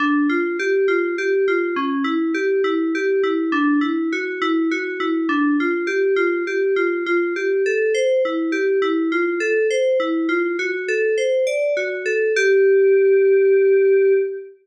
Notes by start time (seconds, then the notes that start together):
0.00 D4
0.29 F4
0.59 G4
0.88 F4
1.18 G4
1.48 F4
1.76 C#4
2.04 E4
2.34 G4
2.64 E4
2.95 G4
3.23 E4
3.52 D4
3.81 E4
4.12 F#4
4.42 E4
4.71 F#4
5.00 E4
5.29 D4
5.60 F4
5.87 G4
6.16 F4
6.47 G4
6.76 F4
7.06 F4
7.36 G4
7.66 A4
7.94 C5
8.25 E4
8.52 G4
8.82 E4
9.12 F4
9.40 A4
9.70 C5
10.00 E4
10.29 F4
10.59 F#4
10.88 A4
11.18 C5
11.47 D5
11.77 F#4
12.06 A4
12.36 G4